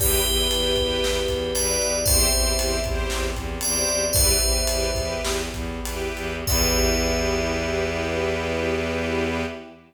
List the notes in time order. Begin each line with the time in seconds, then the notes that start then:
0.00 E2 B3 E4 G4 B4, kick, crash
0.26 E2 E4 G4 B4, ride
0.51 E2 E4 G4 B4, ride
0.76 E2 E4 G4 B4, kick, ride
1.04 E2, snare
1.28 E2, kick, ride
1.55 E2 E4 G4 B4 D5, ride
1.81 E2, ride
2.05 E2 C4 E4 G4 C5 E5, kick, ride
2.33 E2 E4 G4 C5, ride
2.59 E2 E4 G4 C5, ride
2.84 E2 E4 G4 C5, kick, ride
3.10 E2, snare
3.36 E2, kick, ride
3.61 E2 E4 G4 C5 D5, ride
3.88 E2, ride
4.13 E2 B3 E4 G4 B4 C5 E5, kick, ride
4.39 E2 E4 G4 B4, ride
4.66 E2 E4 G4 B4, ride
4.95 E2 E4 G4 B4, kick, ride
5.23 E2, snare
5.53 E2, kick, ride
5.83 E2 E4 G4 B4, ride
6.15 E2, ride
6.47 E2 B3 E4 G4 B4 E5, kick, crash